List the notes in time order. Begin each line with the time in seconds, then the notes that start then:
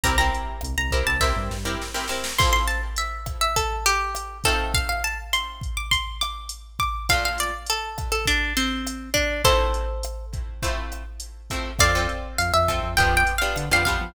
0.03 C2 C4 E4 G4 A#4 A#5, kick, closed hi-hat
0.18 C4 E4 G4 A#4 A#5
0.34 closed hi-hat
0.61 C2, cross-stick, closed hi-hat
0.77 C2 A#5
0.91 C4 E4 G4 A#4, kick, closed hi-hat
1.07 C2 A5
1.20 C4 E4 G4 A#4 E5, kick, snare
1.36 G2
1.50 G2, snare
1.65 C4 E4 G4 A#4
1.82 snare
1.94 C4 E4 G4 A#4, snare
2.08 C4 E4 G4 A#4, snare
2.24 snare
2.38 F3 C4 E4 A4 C6, kick, cross-stick, crash
2.53 C6
2.68 A5, closed hi-hat
2.96 E5, closed hi-hat
3.26 kick, cross-stick, closed hi-hat
3.41 E5
3.56 A4, kick, closed hi-hat
3.86 G4, closed hi-hat
4.15 cross-stick, closed hi-hat
4.44 A3 C4 D#4 F4 A4, kick, closed hi-hat
4.74 F5, kick, closed hi-hat
4.89 F5
5.04 A5, closed hi-hat
5.33 C6, cross-stick, closed hi-hat
5.61 kick, closed hi-hat
5.77 D6
5.91 C6, kick, closed hi-hat
6.21 D6, cross-stick, closed hi-hat
6.49 closed hi-hat
6.79 D6, kick, closed hi-hat
7.09 A#2 A3 D4 F4 F5, kick, cross-stick, closed hi-hat
7.25 F5
7.38 D5, closed hi-hat
7.66 A4, closed hi-hat
7.98 kick, cross-stick, closed hi-hat
8.12 A4
8.25 D4, kick, closed hi-hat
8.57 C4, closed hi-hat
8.87 cross-stick, closed hi-hat
9.14 D4, kick, closed hi-hat
9.44 F3 A3 C4 E4 A4 C5, kick, closed hi-hat
9.74 closed hi-hat
10.03 cross-stick, closed hi-hat
10.33 kick, closed hi-hat
10.62 F3 A3 C4 E4, kick, closed hi-hat
10.92 cross-stick, closed hi-hat
11.20 closed hi-hat
11.50 F3 A3 C4 E4, kick, closed hi-hat
11.79 F2 C4 F4 A4 D5 F5, kick, cross-stick, closed hi-hat
11.95 C4 F4 A4
12.09 closed hi-hat
12.38 F2 F5, closed hi-hat
12.54 F2 E5
12.68 C4 F4 A4, kick, cross-stick, closed hi-hat
12.83 F2
12.97 F2 B3 D4 F4 G4 G5, kick, closed hi-hat
13.17 G5
13.27 closed hi-hat
13.38 B3 D4 F4 G4 F5
13.56 D3, cross-stick, closed hi-hat
13.71 F2 B3 D4 F4 G4 F5
13.85 B3 D4 F4 G4 F5, kick, closed hi-hat
14.01 F3